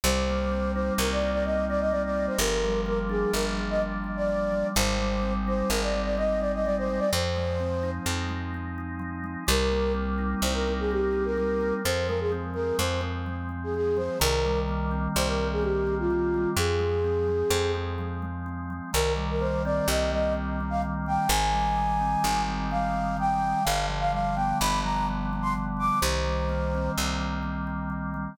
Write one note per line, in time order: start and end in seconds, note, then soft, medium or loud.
0.04 0.91 C2 loud
0.04 0.99 G3 medium
0.04 0.72 C5 loud
0.29 1.21 A#3 medium
0.51 1.45 C4 soft
0.74 1.69 D#4 medium
0.74 0.93 C5 medium
0.98 2.29 C2 medium
0.98 1.92 G3 medium
0.98 1.10 A#4 medium
1.12 1.31 D5 loud
1.21 2.16 A#3 medium
1.32 1.43 D5 loud
1.45 2.36 C4 medium
1.45 1.65 D#5 medium
1.69 2.37 D#4 medium
1.69 1.80 D5 loud
1.80 1.91 D#5 medium
1.91 2.37 G3 medium
1.91 2.02 D5 loud
2.05 2.26 D5 medium
2.16 2.39 A#3 medium
2.27 2.38 C5 medium
2.38 3.25 G1 loud
2.38 3.34 F3 medium
2.38 2.80 A#4 loud
2.65 3.57 G3 medium
2.86 3.81 A#3 medium
2.86 2.99 A#4 medium
3.09 4.04 D4 medium
3.09 3.31 G#4 medium
3.34 4.64 G1 medium
3.34 4.28 F3 medium
3.34 3.45 A#4 medium
3.57 4.52 G3 medium
3.70 3.81 D#5 medium
3.82 4.72 A#3 medium
4.04 4.71 D4 medium
4.17 4.67 D5 medium
4.29 4.73 F3 medium
4.52 4.75 G3 medium
4.75 5.63 G#1 loud
4.75 5.70 G3 medium
4.75 5.33 C5 loud
4.99 5.93 G#3 medium
5.23 6.17 C4 medium
5.48 6.41 D#4 medium
5.48 5.70 C5 loud
5.69 7.00 G#1 medium
5.69 6.66 G3 medium
5.69 5.81 A#4 medium
5.82 6.01 D5 medium
5.93 6.89 G#3 medium
6.05 6.16 D5 medium
6.17 7.07 C4 medium
6.17 6.40 D#5 medium
6.40 7.09 D#4 medium
6.40 6.52 D5 medium
6.54 6.65 D#5 medium
6.65 7.11 G3 medium
6.65 6.76 D5 loud
6.78 7.00 C5 loud
6.89 7.12 G#3 medium
6.99 7.10 D5 loud
7.13 8.00 F2 loud
7.13 8.07 F3 medium
7.13 7.90 C5 loud
7.36 8.28 G#3 medium
7.60 8.54 C4 medium
7.83 8.77 D#4 medium
8.06 9.36 F2 medium
8.06 8.99 F3 medium
8.29 9.23 G#3 medium
8.54 9.44 C4 medium
8.78 9.45 D#4 medium
8.99 9.44 F3 medium
9.24 9.46 G#3 medium
9.47 10.35 C2 loud
9.47 10.41 G3 medium
9.47 9.92 A#4 loud
9.72 10.67 A#3 medium
9.94 10.91 C4 medium
10.18 11.12 D#4 medium
10.42 11.73 C2 medium
10.42 11.37 G3 medium
10.42 10.54 C5 medium
10.54 10.73 A#4 medium
10.68 11.60 A#3 medium
10.80 10.91 G#4 medium
10.91 11.81 C4 medium
10.91 11.25 G4 medium
11.13 11.80 D#4 medium
11.25 11.74 A#4 medium
11.37 11.82 G3 medium
11.61 11.83 A#3 medium
11.85 12.72 F2 medium
11.85 12.53 F3 medium
11.85 12.07 C5 loud
12.08 12.78 G#3 medium
12.08 12.19 A#4 medium
12.20 12.32 G#4 medium
12.32 13.00 C4 medium
12.54 13.26 F3 medium
12.54 12.76 A#4 medium
12.78 14.09 F2 medium
12.78 13.49 G#3 medium
12.78 13.01 C5 medium
13.01 13.74 C4 medium
13.26 13.96 F3 medium
13.49 14.16 G#3 medium
13.64 13.75 G#4 medium
13.74 14.19 C4 medium
13.74 13.98 G#4 loud
13.97 14.19 F3 medium
13.97 14.19 C5 medium
14.20 15.08 C2 loud
14.20 15.15 D#3 medium
14.20 14.60 A#4 loud
14.45 15.38 G3 medium
14.69 15.61 A#3 medium
14.91 15.86 C4 medium
15.16 16.46 C2 loud
15.16 16.10 D#3 medium
15.16 15.28 C5 loud
15.28 15.47 A#4 medium
15.38 16.34 G3 medium
15.52 15.63 G#4 medium
15.62 16.52 A#3 medium
15.62 15.95 G4 medium
15.87 16.54 C4 medium
15.99 16.49 F4 medium
16.10 16.55 D#3 medium
16.34 16.57 G3 medium
16.56 17.44 F2 loud
16.56 17.27 F3 medium
16.56 17.72 G#4 medium
16.79 17.52 G#3 medium
17.04 17.74 C4 medium
17.28 17.98 F3 medium
17.50 18.81 F2 loud
17.50 18.22 G#3 medium
17.75 18.46 C4 medium
17.98 18.70 F3 medium
18.22 18.90 G#3 medium
18.46 18.91 C4 medium
18.70 18.93 F3 medium
18.93 19.81 C2 loud
18.93 19.88 D#3 medium
18.93 19.13 A#4 loud
19.16 20.11 G3 medium
19.30 19.42 A#4 medium
19.40 20.34 A#3 medium
19.40 19.62 C5 loud
19.65 20.60 C4 medium
19.65 19.87 D5 medium
19.88 21.18 C2 loud
19.88 20.82 D#3 medium
19.88 20.11 D#5 medium
20.11 21.06 G3 medium
20.11 20.33 D#5 medium
20.35 21.25 A#3 medium
20.60 21.28 C4 medium
20.70 20.81 F5 medium
20.82 21.27 D#3 medium
21.06 21.29 G3 medium
21.06 21.30 G5 medium
21.28 22.16 G#1 loud
21.28 22.25 D#3 medium
21.28 22.42 G#5 loud
21.52 22.47 G3 medium
21.77 22.71 G#3 medium
22.01 22.93 C4 medium
22.24 23.54 G#1 medium
22.24 23.17 D#3 medium
22.48 23.42 G3 medium
22.71 23.61 G#3 medium
22.71 23.17 F5 medium
22.93 23.61 C4 medium
23.17 23.62 D#3 medium
23.17 23.64 G5 loud
23.43 23.65 G3 medium
23.64 24.54 G1 medium
23.64 24.60 D3 medium
23.64 23.86 F5 loud
23.88 24.83 F3 medium
24.00 24.11 F5 loud
24.12 25.08 G3 medium
24.12 24.36 F5 medium
24.35 25.32 B3 medium
24.35 24.58 G5 medium
24.60 25.91 G1 medium
24.60 25.55 D3 medium
24.60 24.80 B5 loud
24.83 25.76 F3 medium
24.83 25.06 A#5 medium
25.08 25.98 G3 medium
25.33 26.00 B3 medium
25.42 25.53 C6 loud
25.55 26.00 D3 medium
25.77 25.99 F3 medium
25.77 25.99 D6 loud
26.01 26.89 C2 loud
26.01 26.97 D#3 medium
26.01 26.91 C5 medium
26.25 27.20 G3 medium
26.49 27.42 A#3 medium
26.75 27.67 C4 medium
26.98 28.28 C2 medium
26.98 27.89 D#3 medium
27.21 28.13 G3 medium
27.43 28.33 A#3 medium
27.67 28.34 C4 medium
27.90 28.35 D#3 medium
28.14 28.37 G3 medium